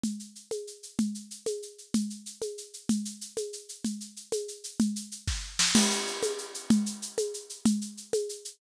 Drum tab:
CC |------|------|------|------|
SH |xxxxxx|xxxxxx|xxxxxx|xxxxxx|
SD |------|------|------|------|
CG |O--o--|O--o--|O--o--|O--o--|
BD |------|------|------|------|

CC |------|------|x-----|------|
SH |xxxxxx|xxx---|xxxxxx|xxxxxx|
SD |------|---o-o|------|------|
CG |O--o--|O-----|O--o--|O--o--|
BD |------|---o--|------|------|

CC |------|
SH |xxxxxx|
SD |------|
CG |O--o--|
BD |------|